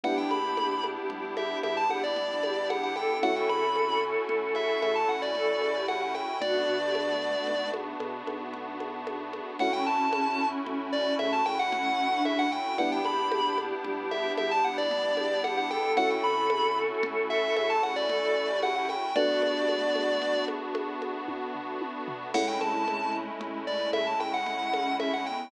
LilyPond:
<<
  \new Staff \with { instrumentName = "Lead 1 (square)" } { \time 6/4 \key a \mixolydian \tempo 4 = 113 fis''16 g''16 b''4~ b''16 r8. e''8 e''16 a''16 fis''16 d''4~ d''16 fis''16 fis''16 g''8 | fis''16 g''16 b''4~ b''16 r8. e''8 e''16 a''16 fis''16 d''4~ d''16 fis''16 fis''16 g''8 | d''2~ d''8 r2. r8 | fis''16 g''16 a''4~ a''16 r8. d''8 e''16 a''16 g''16 fis''4~ fis''16 e''16 fis''16 g''8 |
fis''16 g''16 b''4~ b''16 r8. e''8 e''16 a''16 fis''16 d''4~ d''16 fis''16 fis''16 g''8 | fis''16 g''16 b''4~ b''16 r8. e''8 e''16 a''16 fis''16 d''4~ d''16 fis''16 fis''16 g''8 | d''2~ d''8 r2. r8 | fis''16 g''16 a''4~ a''16 r8. d''8 e''16 a''16 g''16 fis''4~ fis''16 e''16 fis''16 g''8 | }
  \new Staff \with { instrumentName = "Choir Aahs" } { \time 6/4 \key a \mixolydian g'1 r8 g'4 a'8 | a'1 a'8. g'8. r8 | fis'8. g'16 a4. r2. r8 | cis'1 cis'8. d'8. r8 |
g'1 r8 g'4 a'8 | a'1 a'8. g'8. r8 | fis'8. g'16 a4. r2. r8 | a1 r8 cis'4 b8 | }
  \new Staff \with { instrumentName = "Electric Piano 1" } { \time 6/4 \key a \mixolydian <b d' e' g'>8 ais4. g4 g8 g2~ g8 | <a cis' e' fis'>8 c4. a4 a8 a2~ a8 | r8 d4. b4 b8 b2~ b8 | <a cis' e' fis'>8 c4. a4 a8 a2~ a8 |
<b d' e' g'>8 ais4. g4 g8 g2~ g8 | <a cis' e' fis'>8 c4. a4 a8 a2~ a8 | <a b d' fis'>1. | <gis a cis' e'>1. | }
  \new Staff \with { instrumentName = "Synth Bass 1" } { \clef bass \time 6/4 \key a \mixolydian g,,8 ais,,4. g,,4 g,8 g,,2~ g,,8 | a,,8 c,4. a,,4 a,8 a,,2~ a,,8 | b,,8 d,4. b,,4 b,8 b,,2~ b,,8 | a,,8 c,4. a,,4 a,8 a,,2~ a,,8 |
g,,8 ais,,4. g,,4 g,8 g,,2~ g,,8 | a,,8 c,4. a,,4 a,8 a,,2~ a,,8 | r1. | a,,8 c,4. a,,4 a,8 a,,2~ a,,8 | }
  \new Staff \with { instrumentName = "Pad 5 (bowed)" } { \time 6/4 \key a \mixolydian <b d' e' g'>1. | <a cis' e' fis'>1. | <a b d' fis'>1. | <a cis' e' fis'>1. |
<b d' e' g'>1. | <a cis' e' fis'>1. | <a b d' fis'>1. | <gis a cis' e'>1. | }
  \new DrumStaff \with { instrumentName = "Drums" } \drummode { \time 6/4 cgl8 cgho8 cgho8 cgho8 cgl8 cgho8 cgho8 cgho8 cgl8 cgho8 cgho8 cgho8 | cgl8 cgho8 cgho4 cgl8 cgho8 cgho4 cgl8 cgho8 cgho8 cgho8 | cgl4 cgho4 cgl8 cgho8 cgho8 cgho8 cgl8 cgho8 cgho8 cgho8 | cgl4 cgho4 cgl4 cgho8 cgho8 cgl4 cgho4 |
cgl8 cgho8 cgho8 cgho8 cgl8 cgho8 cgho4 cgl8 cgho8 cgho8 cgho8 | cgl4 cgho4 cgl4 cgho8 cgho8 cgl4 cgho8 cgho8 | cgl8 cgho8 cgho8 cgho8 cgl8 cgho8 cgho8 cgho8 <bd tommh>8 tomfh8 tommh8 tomfh8 | <cgl cymc>8 cgho8 cgho4 cgl4 cgho8 cgho8 cgl8 cgho8 cgho4 | }
>>